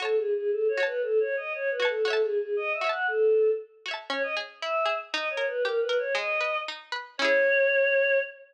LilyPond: <<
  \new Staff \with { instrumentName = "Choir Aahs" } { \time 2/4 \key fis \dorian \tempo 4 = 117 \tuplet 3/2 { a'8 gis'8 gis'8 a'8 cis''8 b'8 } | \tuplet 3/2 { a'8 cis''8 dis''8 cis''8 b'8 a'8 } | \tuplet 3/2 { a'8 gis'8 gis'8 dis''8 e''8 fis''8 } | a'4 r4 |
\key cis \dorian cis''16 dis''16 r8 e''8. r16 | \tuplet 3/2 { dis''8 cis''8 b'8 ais'8 b'8 cis''8 } | dis''4 r4 | cis''2 | }
  \new Staff \with { instrumentName = "Pizzicato Strings" } { \time 2/4 \key fis \dorian <fis' cis'' a''>4. <fis' cis'' a''>8~ | <fis' cis'' a''>4. <fis' cis'' a''>8 | <fis' cis'' e'' a''>4. <fis' cis'' e'' a''>8~ | <fis' cis'' e'' a''>4. <fis' cis'' e'' a''>8 |
\key cis \dorian cis'8 gis'8 e'8 gis'8 | dis'8 ais'8 g'8 ais'8 | gis8 b'8 dis'8 b'8 | <cis' e' gis'>2 | }
>>